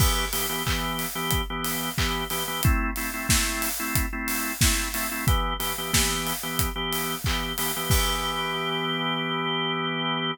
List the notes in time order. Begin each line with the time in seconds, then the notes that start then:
0.00 E3 B3 G4, kick, crash
0.33 E3 B3 G4, open hi-hat
0.49 E3 B3 G4
0.66 E3 B3 G4, kick, clap
0.99 open hi-hat
1.15 E3 B3 G4
1.31 kick, closed hi-hat
1.50 E3 B3 G4
1.64 open hi-hat
1.98 E3 B3 G4, kick, clap
2.30 E3 B3 G4, open hi-hat
2.48 E3 B3 G4
2.63 A3 C4 E4, kick, closed hi-hat
2.96 A3 C4 E4, open hi-hat
3.14 A3 C4 E4
3.29 A3 C4 E4, kick, snare
3.62 open hi-hat
3.80 A3 C4 E4
3.95 kick, closed hi-hat
4.13 A3 C4 E4
4.28 open hi-hat
4.61 A3 C4 E4, kick, snare
4.94 A3 C4 E4, open hi-hat
5.11 A3 C4 E4
5.27 E3 B3 G4, kick, closed hi-hat
5.60 E3 B3 G4, open hi-hat
5.78 E3 B3 G4
5.93 E3 B3 G4, kick, snare
6.27 open hi-hat
6.43 E3 B3 G4
6.59 kick, closed hi-hat
6.76 E3 B3 G4
6.93 open hi-hat
7.24 E3 B3 G4, kick, clap
7.58 E3 B3 G4, open hi-hat
7.76 E3 B3 G4
7.90 E3 B3 G4, kick, crash